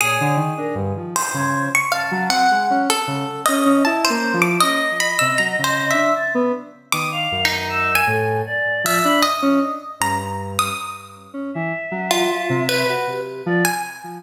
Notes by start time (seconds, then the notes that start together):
0.00 A#2 G#4 C#5
0.21 D3
0.37 D#3
0.57 D4 A#4
0.75 G2
0.97 F3
1.16 C5
1.34 C#3 G#6
1.75 C#6
1.92 F5 A5
2.11 F#3
2.29 C4 F#5
2.51 G#3
2.70 C#4
2.90 A4
3.07 C#3
3.46 C#4 D#5
3.65 C#4
3.85 E4 A5
4.05 C5
4.10 A#3
4.33 F3
4.42 D6
4.60 C#4 D#5
5.00 B5
5.19 C3 E6
5.38 F#3 A#5
5.58 C#3
5.64 C5
5.91 D4 E5
6.16 A6
6.34 B3
6.92 D#3 D6 D#6
7.12 F5
7.32 F#2
7.45 D#4
7.69 E6
7.95 G#5
8.07 A2 A4
8.46 D5
8.84 F3 E5
9.03 D4 B5
9.22 D#5
9.42 C#4
10.00 G2 A#5
10.59 D#6
11.33 C#4
11.54 E3 E5
11.91 F#3
12.11 F4
12.49 C3
12.69 B4
12.89 F#4
13.07 G4
13.46 F3 D5
13.65 G#5